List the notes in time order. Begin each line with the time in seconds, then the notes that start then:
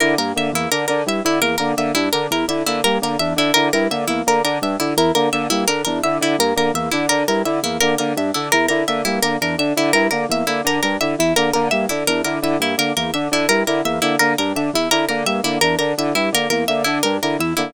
0.00 D3 E4 A#4
0.18 G2 A#3 A#4
0.35 D3 A#3 E5
0.52 E2 A#3 E4
0.71 D3 D4 A#4
0.88 D3 D4 A#4
1.06 G2 E4 E5
1.24 D3 E4
1.41 E2 A#3 A#4
1.58 D3 A#3 A#4
1.77 D3 A#3 E5
1.95 G2 D4 E4
2.13 D3 D4 A#4
2.31 E2 E4 A#4
2.48 D3 E4 E5
2.66 D3 A#3 E4
2.84 G2 A#3 A#4
3.02 D3 A#3 A#4
3.19 E2 D4 E5
3.36 D3 D4 E4
3.54 D3 E4 A#4
3.73 G2 E4 A#4
3.91 D3 A#3 E5
4.07 E2 A#3 E4
4.26 D3 A#3 A#4
4.44 D3 D4 A#4
4.61 G2 D4 E5
4.79 D3 E4
4.97 E2 E4 A#4
5.15 D3 A#3 A#4
5.33 D3 A#3 E5
5.50 G2 A#3 E4
5.68 D3 D4 A#4
5.85 E2 D4 A#4
6.03 D3 E4 E5
6.21 D3 E4
6.38 G2 A#3 A#4
6.56 D3 A#3 A#4
6.74 E2 A#3 E5
6.91 D3 D4 E4
7.09 D3 D4 A#4
7.28 G2 E4 A#4
7.45 D3 E4 E5
7.63 E2 A#3 E4
7.80 D3 A#3 A#4
7.98 D3 A#3 A#4
8.16 G2 D4 E5
8.34 D3 D4 E4
8.52 E2 E4 A#4
8.68 D3 E4 A#4
8.88 D3 A#3 E5
9.05 G2 A#3 E4
9.22 D3 A#3 A#4
9.41 E2 D4 A#4
9.58 D3 D4 E5
9.76 D3 E4
9.93 G2 E4 A#4
10.11 D3 A#3 A#4
10.29 E2 A#3 E5
10.47 D3 A#3 E4
10.64 D3 D4 A#4
10.83 G2 D4 A#4
11.01 D3 E4 E5
11.18 E2 E4
11.36 D3 A#3 A#4
11.53 D3 A#3 A#4
11.71 G2 A#3 E5
11.89 D3 D4 E4
12.07 E2 D4 A#4
12.24 D3 E4 A#4
12.42 D3 E4 E5
12.60 G2 A#3 E4
12.78 D3 A#3 A#4
12.96 E2 A#3 A#4
13.13 D3 D4 E5
13.31 D3 D4 E4
13.49 G2 E4 A#4
13.67 D3 E4 A#4
13.84 E2 A#3 E5
14.02 D3 A#3 E4
14.19 D3 A#3 A#4
14.38 G2 D4 A#4
14.55 D3 D4 E5
14.73 E2 E4
14.91 D3 E4 A#4
15.09 D3 A#3 A#4
15.26 G2 A#3 E5
15.43 D3 A#3 E4
15.61 E2 D4 A#4
15.79 D3 D4 A#4
15.98 D3 E4 E5
16.15 G2 E4
16.32 D3 A#3 A#4
16.50 E2 A#3 A#4
16.68 D3 A#3 E5
16.84 D3 D4 E4
17.03 G2 D4 A#4
17.22 D3 E4 A#4
17.39 E2 E4 E5
17.57 D3 A#3 E4